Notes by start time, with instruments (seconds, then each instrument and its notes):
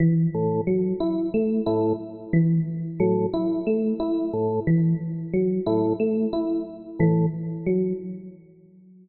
0.00 electric piano 1 E3
0.34 drawbar organ A2
0.67 electric piano 1 F#3
1.00 electric piano 1 E4
1.34 electric piano 1 A3
1.66 drawbar organ A2, electric piano 1 E4
2.33 electric piano 1 E3
3.00 drawbar organ A2, electric piano 1 F#3
3.33 electric piano 1 E4
3.67 electric piano 1 A3
4.00 electric piano 1 E4
4.33 drawbar organ A2
4.67 electric piano 1 E3
5.33 electric piano 1 F#3
5.66 drawbar organ A2, electric piano 1 E4
6.00 electric piano 1 A3
6.33 electric piano 1 E4
6.99 drawbar organ A2, electric piano 1 E3
7.66 electric piano 1 F#3